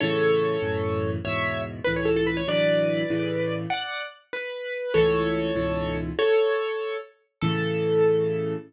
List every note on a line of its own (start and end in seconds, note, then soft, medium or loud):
0.00 0.57 A2 loud
0.00 0.57 C#3 medium
0.00 0.57 E3 loud
0.00 1.10 A4 medium
0.00 1.10 C#5 loud
0.62 1.18 F#2 loud
0.62 1.18 A2 medium
0.62 1.18 C#3 medium
0.62 1.18 E3 medium
1.25 1.80 E2 medium
1.25 1.80 G#2 medium
1.25 1.80 B2 medium
1.25 1.62 C#5 medium
1.25 1.62 E5 loud
1.84 2.43 C#2 medium
1.84 2.43 A2 loud
1.84 2.43 E3 medium
1.84 1.94 B4 loud
1.96 2.06 C#5 medium
2.05 2.15 A4 medium
2.16 2.26 A4 loud
2.27 2.36 B4 loud
2.37 2.47 C#5 medium
2.48 3.03 D2 medium
2.48 3.03 A2 medium
2.48 3.03 E3 loud
2.48 3.03 F#3 medium
2.48 3.55 B4 medium
2.48 3.55 D5 loud
3.10 3.66 A2 loud
3.10 3.66 C#3 loud
3.10 3.66 E3 medium
3.70 4.03 D5 medium
3.70 4.03 F#5 loud
4.33 4.94 B4 loud
4.94 5.51 C#2 loud
4.94 5.51 A2 loud
4.94 5.51 E3 loud
4.94 5.97 A4 loud
4.94 5.97 C#5 loud
5.56 6.11 C#2 loud
5.56 6.11 G#2 loud
5.56 6.11 B2 medium
5.56 6.11 E3 loud
6.19 6.97 A4 loud
6.19 6.97 C#5 loud
7.41 8.55 A2 loud
7.41 8.55 C#3 loud
7.41 8.55 E3 loud
7.41 8.54 A4 loud